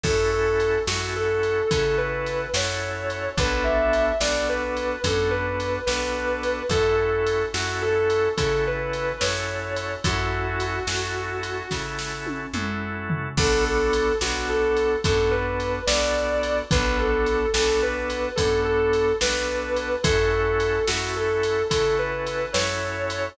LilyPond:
<<
  \new Staff \with { instrumentName = "Distortion Guitar" } { \time 12/8 \key fis \minor \tempo 4. = 72 a'8 a'4 fis'8 a'4 a'8 b'4 cis''4. | b'8 e''4 d''8 b'4 a'8 b'4 b'4. | a'8 a'4 fis'8 a'4 a'8 b'4 cis''4. | fis'2.~ fis'8 r2 r8 |
a'8 a'4 fis'8 a'4 a'8 b'4 d''4. | b'8 a'4 a'8 b'4 a'8 a'4 b'4. | a'8 a'4 fis'8 a'4 a'8 b'4 cis''4. | }
  \new Staff \with { instrumentName = "Drawbar Organ" } { \time 12/8 \key fis \minor <cis' e' fis' a'>4. <cis' e' fis' a'>4. <cis' e' fis' a'>4. <cis' e' fis' a'>4. | <b d' fis' a'>4. <b d' fis' a'>4. <b d' fis' a'>4. <b d' fis' a'>4. | <cis' e' fis' a'>4. <cis' e' fis' a'>4. <cis' e' fis' a'>4. <cis' e' fis' a'>4. | <cis' e' fis' a'>4. <cis' e' fis' a'>4. <cis' e' fis' a'>4. <cis' e' fis' a'>4. |
<b d' fis' a'>4. <b d' fis' a'>4. <b d' fis' a'>4. <b d' fis' a'>4. | <b d' fis' a'>4. <b d' fis' a'>4. <b d' fis' a'>4. <b d' fis' a'>4. | <cis' e' fis' a'>4. <cis' e' fis' a'>4. <cis' e' fis' a'>4. <cis' e' fis' a'>4. | }
  \new Staff \with { instrumentName = "Electric Bass (finger)" } { \clef bass \time 12/8 \key fis \minor fis,4. fis,4. cis4. fis,4. | b,,4. b,,4. fis,4. b,,4. | fis,4. fis,4. cis4. fis,4. | fis,4. fis,4. cis4. fis,4. |
b,,4. b,,4. fis,4. b,,4. | b,,4. b,,4. fis,4. b,,4. | fis,4. fis,4. cis4. fis,4. | }
  \new DrumStaff \with { instrumentName = "Drums" } \drummode { \time 12/8 <cymc bd>4 cymr8 sn4 cymr8 <bd cymr>4 cymr8 sn4 cymr8 | <bd cymr>4 cymr8 sn4 cymr8 <bd cymr>4 cymr8 sn4 cymr8 | <bd cymr>4 cymr8 sn4 cymr8 <bd cymr>4 cymr8 sn4 cymr8 | <bd cymr>4 cymr8 sn4 cymr8 <bd sn>8 sn8 tommh8 toml4 tomfh8 |
<cymc bd>4 cymr8 sn4 cymr8 <bd cymr>4 cymr8 sn4 cymr8 | <bd cymr>4 cymr8 sn4 cymr8 <bd cymr>4 cymr8 sn4 cymr8 | <bd cymr>4 cymr8 sn4 cymr8 <bd cymr>4 cymr8 sn4 cymr8 | }
>>